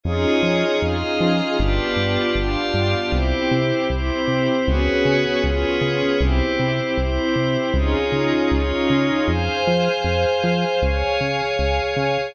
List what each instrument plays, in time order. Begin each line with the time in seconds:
0.04 synth bass 1 F2, pad 5 (bowed) C#4 D#4 F4 G#4 C#5 D#5
0.43 synth bass 1 F3
0.82 synth bass 1 F2, pad 5 (bowed) F4 G#4 D#5 F5
1.20 synth bass 1 F3
1.59 synth bass 1 G1, pad 5 (bowed) B3 D4 F4 G4 B4 D5
1.96 synth bass 1 G2
2.35 synth bass 1 G1, pad 5 (bowed) F4 G4 D5 F5
2.74 synth bass 1 G2
3.11 synth bass 1 C2, pad 5 (bowed) C4 E4 G4 C5
3.51 synth bass 1 C3
3.90 synth bass 1 C2, pad 5 (bowed) C4 E4 C5
4.28 synth bass 1 C3
4.66 synth bass 1 C#2, pad 5 (bowed) B3 C#4 F#4 G#4 B4 C#5
5.05 synth bass 1 C#3
5.43 synth bass 1 C#2, pad 5 (bowed) B3 C#4 F4 G#4 B4 C#5
5.81 synth bass 1 C#3
6.20 synth bass 1 C2, pad 5 (bowed) C4 E4 G4 C5
6.59 synth bass 1 C3
6.97 synth bass 1 C2, pad 5 (bowed) C4 E4 C5
7.36 synth bass 1 C3
7.74 synth bass 1 C#2, pad 5 (bowed) C#4 D#4 F4 G#4 C#5
8.12 synth bass 1 C#3
8.50 synth bass 1 C#2, pad 5 (bowed) C#4 D#4 F4 C#5
8.90 synth bass 1 C#3
9.27 synth bass 1 F2, pad 5 (bowed) G#4 C5 F5 G#5
9.67 synth bass 1 F3
10.04 synth bass 1 F2
10.44 synth bass 1 F3
10.82 synth bass 1 C#2, pad 5 (bowed) G#4 C#5 F5 G#5
11.21 synth bass 1 C#3
11.59 synth bass 1 C#2
11.96 synth bass 1 C#3